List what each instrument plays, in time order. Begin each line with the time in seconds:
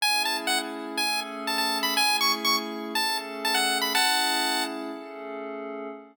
0.01 pad 5 (bowed) A3 C#4 E4 G#4, lead 1 (square) G#5
0.25 lead 1 (square) A5
0.47 lead 1 (square) F#5
0.97 pad 5 (bowed) A3 C#4 G#4 A4, lead 1 (square) G#5
1.47 lead 1 (square) A5
1.58 lead 1 (square) A5
1.83 lead 1 (square) B5
1.95 pad 5 (bowed) A3 C#4 E4 G#4, lead 1 (square) G#5
2.21 lead 1 (square) C#6
2.45 lead 1 (square) C#6
2.95 pad 5 (bowed) A3 C#4 G#4 A4, lead 1 (square) A5
3.45 lead 1 (square) A5
3.54 lead 1 (square) F#5
3.81 lead 1 (square) B5
3.93 pad 5 (bowed) A3 C#4 E4 G#4, lead 1 (square) F#5 A5
4.91 pad 5 (bowed) A3 C#4 G#4 A4